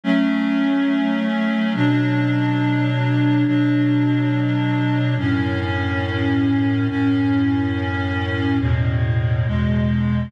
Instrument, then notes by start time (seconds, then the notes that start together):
clarinet
0.04 F#3 A3 C#4
1.75 B2 F#3 D4
3.46 B2 F#3 D4
5.18 F#2 A2 C#4
6.89 F#2 A2 C#4
8.61 E2 A2 B2
9.46 E2 B2 G#3